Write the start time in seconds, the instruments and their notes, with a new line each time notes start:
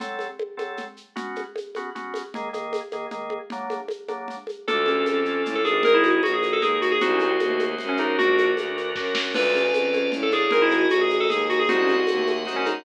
0.00 drawbar organ F#3 C4 A4, low conga, shaker
0.19 high conga, shaker
0.39 high conga
0.57 drawbar organ F#3 C4 A4, high conga, shaker
0.77 low conga, shaker
0.97 shaker
1.16 drawbar organ B3 C#4 F#4, low conga, shaker
1.36 high conga, shaker
1.56 high conga, shaker
1.75 drawbar organ B3 C#4 F#4, high conga, shaker
1.95 drawbar organ B3 C#4 F#4, low conga, shaker
2.14 high conga, shaker
2.34 drawbar organ D#3 A#3 G#4, low conga, shaker
2.53 drawbar organ D#3 A#3 G#4, high conga, shaker
2.73 high conga, shaker
2.92 drawbar organ D#3 A#3 G#4, high conga, shaker
3.11 drawbar organ D#3 A#3 G#4, low conga, shaker
3.30 high conga
3.50 drawbar organ F#3 A#3 D4, low conga, shaker
3.70 high conga, shaker
3.88 high conga, shaker
4.08 drawbar organ F#3 A#3 D4, high conga, shaker
4.28 low conga, shaker
4.47 high conga, shaker
4.68 violin D2, marimba D4, drawbar organ D4 F4 A4, electric piano 2 A4, low conga, shaker
4.86 marimba C#4, high conga, shaker
5.06 violin F2, high conga, shaker
5.25 marimba C#4, shaker
5.45 violin A2, low conga, shaker
5.55 electric piano 2 A4
5.65 violin G#1, marimba D4, electric piano 2 G#4, high conga, shaker
5.83 drawbar organ D#4 G#4 A#4, marimba G#4, electric piano 2 A#4, low conga, shaker
5.94 electric piano 2 E4
6.04 marimba F#4, high conga, shaker
6.23 violin A#1, electric piano 2 F#4, high conga, shaker
6.33 electric piano 2 G#4
6.43 high conga, shaker
6.53 electric piano 2 A4
6.62 violin D#2, drawbar organ D#4 G#4 A#4, electric piano 2 G#4, low conga, shaker
6.82 electric piano 2 F#4, shaker
6.92 electric piano 2 G#4
7.01 violin C2, marimba C4, drawbar organ D#4 F#4 C5, electric piano 2 F#4, low conga, shaker
7.14 marimba C#4
7.20 high conga, shaker
7.27 marimba C4
7.39 violin D#2, high conga, shaker
7.50 marimba A3
7.59 high conga, shaker
7.78 violin F#2, low conga, shaker
7.89 electric piano 2 C#4
7.97 drawbar organ D4 F#4 A#4, electric piano 2 D#4, high conga, shaker
8.18 violin A#1, marimba D4, drawbar organ D4 F#4 A#4, electric piano 2 F#4, low conga, shaker
8.38 high conga, shaker
8.57 violin D2, high conga, shaker
8.77 drawbar organ D4 F#4 A#4, shaker
8.95 violin F#2, drawbar organ D4 F#4 A#4, kick, snare
9.15 snare
9.34 violin D2, marimba D4, drawbar organ D4 F4 A4 D5 F5 A5, electric piano 2 B4, crash, low conga, shaker
9.55 marimba C#4, high conga, shaker
9.73 violin F2, high conga, shaker
9.93 marimba C#4, high conga, shaker
10.12 violin A2, low conga, shaker
10.23 electric piano 2 A4
10.31 drawbar organ D4 F4 A4, marimba D4, electric piano 2 G#4, high conga, shaker
10.50 violin G#1, marimba G#3, drawbar organ D#4 G#4 A#4 D#5 G#5 A#5, electric piano 2 A#4, low conga, shaker
10.62 electric piano 2 E4
10.71 marimba F#4, high conga, shaker
10.90 violin A#1, electric piano 2 F#4, high conga, shaker
11.01 electric piano 2 G#4
11.10 high conga, shaker
11.20 electric piano 2 A4
11.29 violin D#2, electric piano 2 G#4, low conga, shaker
11.49 electric piano 2 F#4, shaker
11.59 electric piano 2 G#4
11.68 violin C2, marimba C4, drawbar organ D#4 F#4 C5 D#5 F#5 C6, electric piano 2 F#4, low conga, shaker
11.82 marimba C#4
11.88 high conga, shaker
11.95 marimba C4
12.07 violin D#2, high conga, shaker
12.18 marimba A3
12.27 high conga, shaker
12.45 violin F#2, drawbar organ D#4 F#4 C5, low conga, shaker
12.56 electric piano 2 C#4
12.66 electric piano 2 D#4, high conga, shaker